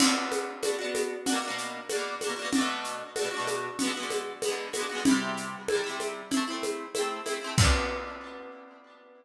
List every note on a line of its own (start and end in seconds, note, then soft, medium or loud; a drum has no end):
0.00 0.51 D4 loud
0.00 0.51 F#4 loud
0.00 crash loud
0.00 low conga loud
0.00 shaker medium
0.06 0.51 B3 medium
0.32 high conga medium
0.32 shaker medium
0.63 0.75 D4 medium
0.63 0.75 F#4 medium
0.63 high conga medium
0.63 shaker medium
0.68 0.75 B3 medium
0.79 1.16 D4 medium
0.79 1.16 F#4 medium
0.84 1.16 B3 medium
0.95 snare soft
0.95 high conga medium
0.95 shaker medium
1.26 1.39 D4 loud
1.26 1.39 F#4 loud
1.26 low conga medium
1.26 shaker medium
1.32 1.39 B2 loud
1.32 1.39 A#3 loud
1.42 1.80 D4 medium
1.42 1.80 F#4 loud
1.48 1.80 B2 medium
1.48 1.80 A#3 medium
1.58 shaker medium
1.89 2.15 D4 medium
1.89 2.15 F#4 loud
1.89 high conga medium
1.89 shaker medium
1.95 2.15 B2 medium
1.95 2.15 A#3 medium
2.21 2.34 D4 medium
2.21 2.34 F#4 medium
2.21 high conga medium
2.21 shaker medium
2.27 2.34 B2 medium
2.27 2.34 A#3 medium
2.36 2.49 D4 medium
2.36 2.49 F#4 medium
2.42 2.49 B2 medium
2.42 2.49 A#3 medium
2.53 3.03 D4 loud
2.53 3.03 F#4 loud
2.53 low conga medium
2.53 shaker medium
2.58 3.03 B2 loud
2.58 3.03 A3 loud
2.84 shaker medium
3.16 3.28 D4 medium
3.16 3.28 F#4 medium
3.16 high conga medium
3.16 shaker medium
3.21 3.28 B2 medium
3.21 3.28 A3 medium
3.31 3.69 D4 medium
3.31 3.69 F#4 medium
3.37 3.69 B2 medium
3.37 3.69 A3 medium
3.47 high conga medium
3.47 shaker medium
3.79 3.92 B3 loud
3.79 3.92 F#4 loud
3.79 low conga medium
3.79 shaker medium
3.85 3.92 D3 loud
3.85 3.92 G#3 loud
3.94 4.32 B3 medium
3.94 4.32 F#4 medium
4.00 4.32 D3 medium
4.00 4.32 G#3 medium
4.10 high conga medium
4.10 shaker medium
4.42 4.68 B3 loud
4.42 4.68 F#4 medium
4.42 high conga medium
4.42 shaker medium
4.48 4.68 D3 medium
4.48 4.68 G#3 medium
4.73 4.86 B3 medium
4.73 4.86 F#4 medium
4.73 high conga medium
4.73 shaker medium
4.79 4.86 D3 medium
4.79 4.86 G#3 medium
4.89 5.02 B3 medium
4.89 5.02 F#4 medium
4.95 5.02 D3 medium
4.95 5.02 G#3 medium
5.05 5.56 G3 loud
5.05 5.56 E4 medium
5.05 low conga loud
5.05 shaker medium
5.11 5.56 C3 loud
5.37 shaker medium
5.68 5.82 G3 medium
5.68 5.82 E4 medium
5.68 high conga medium
5.68 shaker soft
5.75 5.82 C3 medium
5.84 6.22 G3 medium
5.84 6.22 E4 medium
5.89 6.22 C3 medium
6.00 high conga medium
6.00 shaker medium
6.31 6.44 C4 medium
6.31 6.44 E4 loud
6.31 low conga medium
6.31 shaker medium
6.37 6.44 A3 loud
6.48 6.85 C4 medium
6.48 6.85 E4 medium
6.53 6.85 A3 medium
6.63 high conga medium
6.63 shaker medium
6.95 7.21 C4 medium
6.95 7.21 E4 medium
6.95 high conga medium
6.95 shaker medium
7.01 7.21 A3 medium
7.26 7.38 C4 medium
7.26 7.38 E4 medium
7.26 high conga medium
7.26 shaker medium
7.31 7.38 A3 medium
7.41 7.54 C4 medium
7.41 7.54 E4 medium
7.47 7.54 A3 medium
7.58 9.25 D4 loud
7.58 9.25 F#4 loud
7.58 kick loud
7.58 crash loud
7.63 9.25 B3 loud